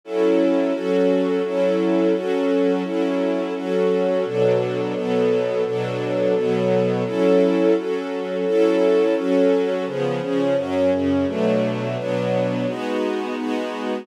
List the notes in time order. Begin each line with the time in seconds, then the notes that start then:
0.04 F#3 C#4 E4 A4
0.73 F#3 C#4 F#4 A4
1.44 F#3 C#4 E4 A4
2.14 F#3 C#4 F#4 A4
2.84 F#3 C#4 E4 A4
3.55 F#3 C#4 F#4 A4
4.25 B2 F#3 D4 A4
4.94 B2 F#3 B3 A4
5.65 B2 F#3 D4 A4
6.35 B2 F#3 B3 A4
7.05 F#3 C#4 E4 A4
7.76 F#3 C#4 F#4 A4
8.45 F#3 C#4 E4 A4
9.15 F#3 C#4 F#4 A4
9.86 C#3 F3 B3 G#4
10.21 C#3 F3 C#4 G#4
10.56 F#2 F#3 C#4
10.91 F#2 C#3 C#4
11.26 B2 F#3 A3 D4
11.97 B2 F#3 B3 D4
12.67 G#3 B3 D#4 F#4
13.36 G#3 B3 D#4 F#4